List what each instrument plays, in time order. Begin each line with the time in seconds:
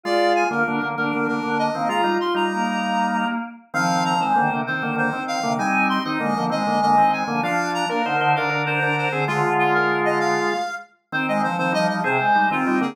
0.04 drawbar organ G#3 F4, choir aahs F4, clarinet D5
0.35 clarinet G#5
0.50 drawbar organ D3 A#3, choir aahs F4, clarinet A#4
0.66 drawbar organ D3 A#3, choir aahs D4
0.80 drawbar organ D3 A#3, choir aahs A#3
0.97 drawbar organ D3 A#3, choir aahs D4, clarinet A#4
1.13 drawbar organ D3 A#3
1.27 drawbar organ D3 A#3, clarinet A#4
1.43 drawbar organ D3 A#3
1.59 clarinet D#5
1.74 drawbar organ D#3 C4, choir aahs A#3
1.89 drawbar organ G#3 F4, choir aahs F4, clarinet A#5
2.04 drawbar organ G3 D#4
2.20 choir aahs F4, clarinet C6
2.34 drawbar organ G3 D#4, clarinet A#5
2.53 choir aahs A#3
3.74 drawbar organ D#3 C4, choir aahs F3, clarinet F5
4.05 clarinet A#5
4.20 drawbar organ D#3 C4, choir aahs G#3, clarinet C5
4.35 drawbar organ D3 A#3, choir aahs D#3
4.50 choir aahs C3, drawbar organ D3 A#3
4.67 choir aahs D#3, drawbar organ D#3 C4, clarinet C5
4.82 drawbar organ D3 A#3
4.96 drawbar organ D3 A#3, clarinet C5
5.13 drawbar organ D#3 C4
5.28 clarinet F5
5.42 choir aahs C3, drawbar organ D3 A#3
5.58 drawbar organ G3 D#4, choir aahs C4, clarinet G#5
5.89 clarinet C6
6.05 drawbar organ D#3 C4, choir aahs D#4, clarinet D#5
6.20 drawbar organ D3 A#3, choir aahs G#3
6.34 drawbar organ D3 A#3, choir aahs F3
6.50 drawbar organ D#3 C4, choir aahs G#3, clarinet D#5
6.67 drawbar organ D3 A#3
6.82 drawbar organ D3 A#3, clarinet D#5
6.98 drawbar organ D#3 C4
7.12 clarinet G#5
7.28 drawbar organ D3 A#3, choir aahs F3
7.43 drawbar organ F3 D4, choir aahs F3, clarinet F5
7.74 clarinet A#5
7.89 choir aahs A#3, drawbar organ D4 A#4, clarinet A#4
8.04 choir aahs D3, drawbar organ D#4 C5
8.20 choir aahs D3, drawbar organ D#4 C5
8.34 choir aahs D3, drawbar organ D4 A#4, clarinet F5
8.50 drawbar organ D4 A#4
8.66 drawbar organ D4 A#4, clarinet C5
8.82 drawbar organ D4 A#4
8.97 clarinet C5
9.12 choir aahs D3, drawbar organ C4 G#4
9.28 choir aahs D3, drawbar organ G#3 F4, clarinet F4
9.43 choir aahs D3
9.59 clarinet F4
9.74 clarinet A#4
10.05 clarinet D#5
10.20 clarinet F5
11.12 drawbar organ D#3 C4, choir aahs C4, clarinet C5
11.27 choir aahs G#3, clarinet D#5
11.43 choir aahs F3, clarinet C5
11.58 drawbar organ D#3 C4, choir aahs F3, clarinet C5
11.72 choir aahs F3, drawbar organ G3 D#4, clarinet D#5
11.88 choir aahs F3, clarinet D#5
12.04 choir aahs C3, drawbar organ C4 G#4, clarinet C5
12.20 choir aahs G#3
12.35 drawbar organ G3 D#4
12.51 drawbar organ D#3 C4, choir aahs C4, clarinet F4
12.67 drawbar organ G3 D#4
12.81 drawbar organ D3 A#3, clarinet G#4